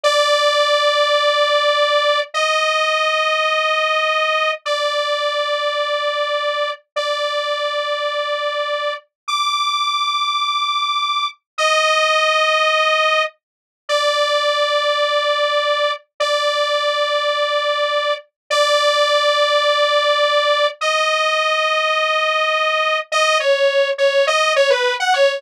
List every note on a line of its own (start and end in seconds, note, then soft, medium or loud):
0.03 2.20 D5 loud
2.34 4.51 D#5 medium
4.65 6.71 D5 medium
6.96 8.93 D5 medium
9.28 11.27 D6 medium
11.58 13.23 D#5 medium
13.89 15.92 D5 medium
16.20 18.14 D5 medium
18.50 20.67 D5 loud
20.81 22.98 D#5 medium
23.12 23.38 D#5 loud
23.40 23.90 C#5 medium
23.98 24.26 C#5 medium
24.27 24.53 D#5 medium
24.56 24.70 C#5 medium
24.70 24.94 B4 medium
25.00 25.13 F#5 medium
25.14 25.41 C#5 medium